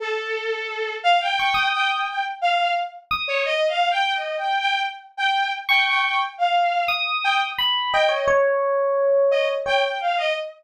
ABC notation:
X:1
M:3/4
L:1/16
Q:1/4=87
K:none
V:1 name="Electric Piano 1"
z8 _d' _e'3 | z6 _e'2 z4 | z9 _d'3 | z4 _e'4 b2 _e _d |
_d8 d z3 |]
V:2 name="Violin"
A6 f g3 g g | g z f2 z3 _d (3_e2 f2 g2 | (3_e2 g2 g2 z2 g2 z g g g | z f3 z2 g z3 g _e |
z6 _e z g g f e |]